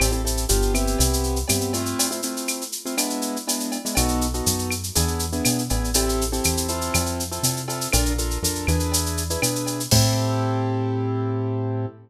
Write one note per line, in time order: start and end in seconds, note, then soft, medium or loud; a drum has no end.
0.00 0.46 A1 medium
0.00 0.10 C4 medium
0.00 0.10 E4 medium
0.00 0.10 G4 medium
0.00 0.10 A4 medium
0.00 cowbell medium
0.00 claves loud
0.00 shaker loud
0.12 0.22 C4 medium
0.12 0.22 E4 medium
0.12 0.22 G4 medium
0.12 0.22 A4 medium
0.12 shaker medium
0.25 0.45 C4 medium
0.25 0.45 E4 medium
0.25 0.45 G4 medium
0.25 0.45 A4 medium
0.25 shaker medium
0.37 shaker medium
0.49 0.96 G1 medium
0.49 0.73 B3 medium
0.49 0.73 D4 medium
0.49 0.73 F4 medium
0.49 0.73 G4 medium
0.49 shaker loud
0.62 shaker medium
0.74 1.39 B3 medium
0.74 1.39 C4 medium
0.74 1.39 E4 medium
0.74 1.39 G4 medium
0.74 claves medium
0.74 shaker medium
0.87 shaker medium
0.98 1.44 C2 medium
0.98 cowbell medium
0.98 shaker loud
1.13 shaker medium
1.23 shaker medium
1.36 shaker medium
1.48 1.94 G2 medium
1.48 1.72 B3 medium
1.48 1.72 C4 medium
1.48 1.72 E4 medium
1.48 1.72 G4 medium
1.48 cowbell medium
1.48 claves medium
1.48 shaker loud
1.61 shaker medium
1.73 2.08 A3 medium
1.73 2.08 C4 medium
1.73 2.08 E4 loud
1.73 2.08 F4 medium
1.73 cowbell medium
1.73 shaker medium
1.86 shaker medium
1.99 cowbell loud
1.99 shaker loud
2.11 2.21 A3 medium
2.11 2.21 C4 medium
2.11 2.21 E4 medium
2.11 2.21 F4 medium
2.11 shaker medium
2.22 2.63 A3 medium
2.22 2.63 C4 medium
2.22 2.63 E4 medium
2.22 2.63 F4 medium
2.22 shaker medium
2.37 shaker medium
2.48 claves medium
2.48 shaker medium
2.61 shaker medium
2.72 shaker medium
2.85 2.95 A3 medium
2.85 2.95 C4 medium
2.85 2.95 E4 medium
2.85 2.95 F4 medium
2.85 shaker medium
2.97 3.37 G#3 medium
2.97 3.37 B3 medium
2.97 3.37 D4 medium
2.97 3.37 E4 medium
2.97 cowbell medium
2.97 claves medium
2.97 shaker loud
3.10 shaker medium
3.22 shaker medium
3.36 shaker medium
3.47 3.77 G#3 medium
3.47 3.77 B3 medium
3.47 3.77 D4 medium
3.47 3.77 E4 medium
3.47 cowbell medium
3.47 shaker loud
3.60 shaker medium
3.72 cowbell medium
3.72 shaker medium
3.85 3.95 G#3 medium
3.85 3.95 B3 medium
3.85 3.95 D4 medium
3.85 3.95 E4 medium
3.85 shaker medium
3.95 4.42 B1 medium
3.95 4.27 B3 medium
3.95 4.27 D#4 medium
3.95 4.27 F#4 medium
3.95 4.27 A4 medium
3.95 cowbell loud
3.95 claves loud
3.95 shaker loud
4.08 shaker medium
4.21 shaker medium
4.34 4.74 B3 medium
4.34 4.74 D#4 medium
4.34 4.74 F#4 medium
4.34 4.74 A4 medium
4.34 shaker medium
4.46 4.91 F#2 medium
4.46 shaker loud
4.59 shaker medium
4.71 claves medium
4.71 shaker medium
4.83 shaker medium
4.95 5.41 E2 medium
4.95 5.25 B3 medium
4.95 5.25 D4 medium
4.95 5.25 E4 medium
4.95 5.25 G#4 medium
4.95 cowbell medium
4.95 shaker loud
5.08 shaker medium
5.19 shaker medium
5.32 5.62 B3 medium
5.32 5.62 D4 medium
5.32 5.62 E4 medium
5.32 5.62 G#4 medium
5.32 shaker medium
5.45 5.69 B2 medium
5.45 cowbell medium
5.45 claves medium
5.45 shaker loud
5.58 shaker medium
5.70 6.40 A1 medium
5.70 5.90 B3 medium
5.70 5.90 D4 medium
5.70 5.90 E4 medium
5.70 5.90 G#4 medium
5.70 cowbell medium
5.70 shaker medium
5.84 shaker medium
5.94 6.24 C4 medium
5.94 6.24 E4 medium
5.94 6.24 G4 medium
5.94 6.24 A4 medium
5.94 cowbell loud
5.94 shaker loud
6.09 shaker medium
6.21 shaker medium
6.32 6.68 C4 medium
6.32 6.68 E4 medium
6.32 6.68 G4 medium
6.32 6.68 A4 medium
6.32 shaker medium
6.44 6.90 E2 medium
6.44 claves medium
6.44 shaker loud
6.57 shaker medium
6.68 7.23 C4 medium
6.68 7.23 E4 medium
6.68 7.23 F4 medium
6.68 7.23 A4 medium
6.68 shaker medium
6.81 shaker medium
6.94 7.39 F2 medium
6.94 cowbell medium
6.94 claves loud
6.94 shaker loud
7.06 shaker medium
7.20 shaker medium
7.32 7.61 C4 medium
7.32 7.61 E4 medium
7.32 7.61 F4 medium
7.32 7.61 A4 medium
7.32 shaker medium
7.43 7.88 C3 medium
7.43 cowbell medium
7.43 shaker loud
7.56 shaker medium
7.68 7.88 C4 medium
7.68 7.88 E4 medium
7.68 7.88 F4 medium
7.68 7.88 A4 medium
7.68 cowbell medium
7.68 shaker medium
7.81 shaker medium
7.93 8.38 A#1 medium
7.93 8.13 D4 loud
7.93 8.13 F4 loud
7.93 8.13 A4 medium
7.93 8.13 A#4 medium
7.93 cowbell loud
7.93 claves loud
7.93 shaker loud
8.05 shaker medium
8.18 8.38 D4 medium
8.18 8.38 F4 medium
8.18 8.38 A4 medium
8.18 8.38 A#4 medium
8.18 shaker medium
8.31 shaker medium
8.43 8.66 F2 medium
8.43 8.66 D4 medium
8.43 8.66 F4 medium
8.43 8.66 A4 medium
8.43 8.66 A#4 medium
8.43 shaker loud
8.55 shaker medium
8.67 9.37 E2 medium
8.67 9.23 D4 medium
8.67 9.23 E4 medium
8.67 9.23 G#4 medium
8.67 9.23 B4 medium
8.67 claves medium
8.67 shaker medium
8.80 shaker medium
8.92 cowbell medium
8.92 shaker loud
9.06 shaker medium
9.17 shaker medium
9.30 9.40 D4 medium
9.30 9.40 E4 medium
9.30 9.40 G#4 medium
9.30 9.40 B4 medium
9.30 shaker medium
9.42 9.87 B2 medium
9.42 9.82 D4 medium
9.42 9.82 E4 medium
9.42 9.82 G#4 medium
9.42 9.82 B4 medium
9.42 cowbell medium
9.42 claves loud
9.42 shaker loud
9.55 shaker medium
9.66 cowbell medium
9.66 shaker medium
9.80 shaker medium
9.91 11.86 A2 loud
9.91 11.86 C4 loud
9.91 11.86 E4 loud
9.91 11.86 G4 loud
9.91 11.86 A4 medium
9.91 kick loud
9.91 crash loud